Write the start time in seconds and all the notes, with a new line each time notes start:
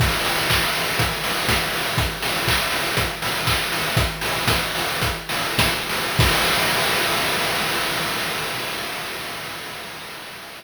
0.00 kick, crash
0.25 open hi-hat
0.50 kick, clap
0.75 open hi-hat
0.99 kick, closed hi-hat
1.24 open hi-hat
1.49 kick, snare
1.74 open hi-hat
1.98 kick, closed hi-hat
2.22 open hi-hat
2.48 kick, clap
2.72 open hi-hat
2.97 kick, closed hi-hat
3.22 open hi-hat
3.47 kick, clap
3.72 open hi-hat
3.97 kick, closed hi-hat
4.21 open hi-hat
4.48 kick, snare
4.75 open hi-hat
5.02 kick, closed hi-hat
5.29 open hi-hat
5.58 kick, snare
5.89 open hi-hat
6.19 kick, crash